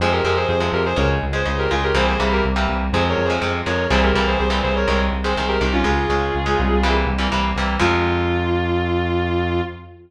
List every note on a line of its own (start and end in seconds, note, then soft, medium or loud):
0.00 0.20 F2 medium
0.00 0.21 C3 medium
0.00 0.21 F3 medium
0.00 0.21 G#3 medium
0.00 0.12 G#4 medium
0.00 0.12 C5 medium
0.12 0.24 G4 medium
0.12 0.24 A#4 medium
0.24 0.45 F2 medium
0.24 0.54 C3 medium
0.24 0.54 F3 medium
0.24 0.54 G#3 medium
0.24 0.36 G4 medium
0.24 0.36 A#4 medium
0.37 0.48 G#4 medium
0.37 0.48 C5 medium
0.49 0.69 F2 medium
0.49 0.68 G#4 medium
0.49 0.68 C5 medium
0.60 0.90 C3 medium
0.60 0.90 F3 medium
0.60 0.90 G#3 medium
0.73 0.93 F2 medium
0.73 0.85 G4 medium
0.73 0.85 A#4 medium
0.86 0.97 G#4 medium
0.86 0.97 C5 medium
0.96 1.18 C#2 loud
0.96 1.26 C#3 medium
0.96 1.26 G#3 medium
0.96 1.09 A#4 medium
0.96 1.09 C#5 medium
1.23 1.43 C#2 medium
1.33 1.43 C#3 medium
1.33 1.43 G#3 medium
1.33 1.55 G#4 medium
1.33 1.55 C5 medium
1.45 1.67 C#2 medium
1.45 1.65 C#3 medium
1.45 1.65 G#3 medium
1.58 1.70 G4 medium
1.58 1.70 A#4 medium
1.70 1.92 C#2 medium
1.70 1.90 C#3 medium
1.70 1.90 G#3 medium
1.70 1.82 F4 medium
1.70 1.82 G#4 medium
1.83 1.95 G4 medium
1.83 1.95 A#4 medium
1.94 2.15 C2 medium
1.94 2.14 C3 medium
1.94 2.14 E3 medium
1.94 2.14 G3 medium
1.94 2.14 A#3 medium
1.94 2.07 G#4 medium
1.94 2.07 C5 medium
2.07 2.19 G#4 medium
2.07 2.19 C5 medium
2.20 2.40 C2 medium
2.20 2.49 C3 medium
2.20 2.49 E3 medium
2.20 2.49 G3 medium
2.20 2.49 A#3 medium
2.32 2.44 G4 medium
2.32 2.44 A#4 medium
2.45 2.65 C2 medium
2.56 2.85 C3 medium
2.56 2.85 E3 medium
2.56 2.85 G3 medium
2.56 2.85 A#3 medium
2.69 2.89 C2 medium
2.93 3.14 F2 loud
2.93 3.23 C3 medium
2.93 3.23 F3 medium
2.93 3.23 G#3 medium
2.93 3.08 G#4 medium
2.93 3.08 C5 medium
3.09 3.24 A#4 medium
3.09 3.24 C#5 medium
3.18 3.39 F2 medium
3.25 3.40 G#4 medium
3.25 3.40 C5 medium
3.30 3.40 C3 medium
3.30 3.40 F3 medium
3.30 3.40 G#3 medium
3.42 3.63 F2 medium
3.42 3.61 C3 medium
3.42 3.61 F3 medium
3.42 3.61 G#3 medium
3.66 3.87 F2 medium
3.66 3.86 C3 medium
3.66 3.86 F3 medium
3.66 3.86 G#3 medium
3.66 3.86 A#4 medium
3.66 3.86 C#5 medium
3.90 4.11 C2 loud
3.90 4.10 A#2 medium
3.90 4.10 C3 medium
3.90 4.10 E3 medium
3.90 4.10 G3 medium
3.90 4.02 G#4 medium
3.90 4.02 C5 medium
4.03 4.14 G4 medium
4.03 4.14 A#4 medium
4.14 4.35 C2 medium
4.14 4.45 A#2 medium
4.14 4.45 C3 medium
4.14 4.45 E3 medium
4.14 4.45 G3 medium
4.14 4.26 G4 medium
4.14 4.26 A#4 medium
4.27 4.38 G#4 medium
4.27 4.38 C5 medium
4.39 4.61 C2 medium
4.39 4.60 G#4 medium
4.39 4.60 C5 medium
4.50 4.79 A#2 medium
4.50 4.79 C3 medium
4.50 4.79 E3 medium
4.50 4.79 G3 medium
4.63 4.84 C2 medium
4.63 4.75 G#4 medium
4.63 4.75 C5 medium
4.76 4.88 A#4 medium
4.76 4.88 C#5 medium
4.88 5.09 C2 loud
4.88 5.17 C3 medium
4.88 5.17 D#3 medium
4.88 5.17 G#3 medium
4.88 5.00 A#4 medium
4.88 5.00 C#5 medium
5.12 5.33 C2 medium
5.24 5.34 C3 medium
5.24 5.34 D#3 medium
5.24 5.34 G#3 medium
5.24 5.46 G#4 medium
5.24 5.46 C5 medium
5.37 5.58 C2 medium
5.37 5.57 C3 medium
5.37 5.57 D#3 medium
5.37 5.57 G#3 medium
5.48 5.60 G4 medium
5.48 5.60 A#4 medium
5.61 5.82 C2 medium
5.61 5.80 C3 medium
5.61 5.80 D#3 medium
5.61 5.80 G#3 medium
5.61 5.73 D#4 medium
5.61 5.73 G4 medium
5.73 5.84 C#4 medium
5.73 5.84 F4 medium
5.84 6.05 C#2 medium
5.84 6.04 C#3 medium
5.84 6.04 G#3 medium
5.84 6.89 F4 medium
5.84 6.89 G#4 medium
6.09 6.30 C#2 medium
6.09 6.39 C#3 medium
6.09 6.39 G#3 medium
6.35 6.55 C#2 medium
6.46 6.75 C#3 medium
6.46 6.75 G#3 medium
6.59 7.04 C2 loud
6.83 7.13 C3 medium
6.83 7.13 E3 medium
6.83 7.13 G3 medium
6.83 7.13 A#3 medium
7.07 7.27 C2 medium
7.18 7.28 C3 medium
7.18 7.28 E3 medium
7.18 7.28 G3 medium
7.18 7.28 A#3 medium
7.32 7.53 C2 medium
7.32 7.51 C3 medium
7.32 7.51 E3 medium
7.32 7.51 G3 medium
7.32 7.51 A#3 medium
7.55 7.76 C2 medium
7.55 7.77 C3 medium
7.55 7.77 E3 medium
7.55 7.77 G3 medium
7.55 7.77 A#3 medium
7.79 9.61 F2 loud
7.79 9.60 C3 loud
7.79 9.60 F3 loud
7.79 9.60 G#3 loud
7.79 9.61 F4 loud